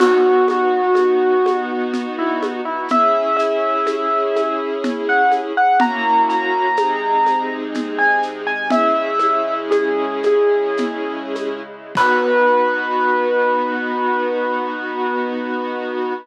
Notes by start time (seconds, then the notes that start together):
0.00 B3 D#4 F#4, crash, low conga, shaker
0.48 F#4, high conga, shaker
0.95 high conga, shaker
1.46 high conga, shaker
1.94 low conga, shaker
2.19 E4
2.43 high conga, shaker
2.65 E4
2.88 C#4 E4 G#4 E5, low conga, shaker
3.36 E5, shaker
3.87 high conga, shaker
4.36 high conga, shaker
4.84 low conga, shaker
5.09 F#5
5.31 high conga, shaker
5.57 F#5
5.80 A#3 C#4 E4 F#4 A#5, low conga, shaker
6.29 A#5, shaker
6.77 C3 G#3 C4 D#4 G#4, high conga, shaker
7.26 high conga, shaker
7.74 low conga, shaker
7.98 G#5
8.23 shaker
8.47 G#5
8.70 C#3 G#3 C#4 E4 G#4 E5, low conga, shaker
9.19 high conga, shaker
9.71 G#4, high conga, shaker
10.23 G#4, high conga, shaker
10.77 low conga, shaker
11.35 high conga, shaker
11.95 B3 D#4 F#4 B4, kick, crash